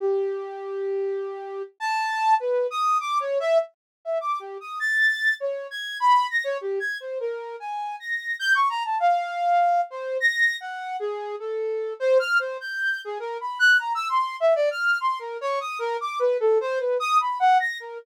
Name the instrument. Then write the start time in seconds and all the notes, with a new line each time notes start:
flute
0.00 G4
1.80 A5
2.40 B4
2.71 D#6
3.00 D6
3.20 C#5
3.40 E5
4.05 E5
4.21 D6
4.40 G4
4.61 D#6
4.80 A6
5.40 C#5
5.71 G#6
6.00 B5
6.30 A#6
6.44 C#5
6.61 G4
6.80 G#6
7.00 C5
7.20 A#4
7.60 G#5
8.00 A#6
8.39 G6
8.55 C#6
8.70 A#5
8.85 A5
9.00 F5
9.90 C5
10.20 A#6
10.61 F#5
11.00 G#4
11.39 A4
12.00 C5
12.19 F6
12.39 C5
12.61 G6
13.05 G#4
13.20 A#4
13.41 B5
13.59 F#6
13.79 A#5
13.95 E6
14.09 C6
14.40 E5
14.56 D5
14.71 F6
15.01 C6
15.19 A#4
15.41 C#5
15.61 D#6
15.79 A#4
16.01 D6
16.19 B4
16.40 A4
16.61 C5
16.79 B4
17.00 D#6
17.20 B5
17.39 F#5
17.60 A#6
17.80 A#4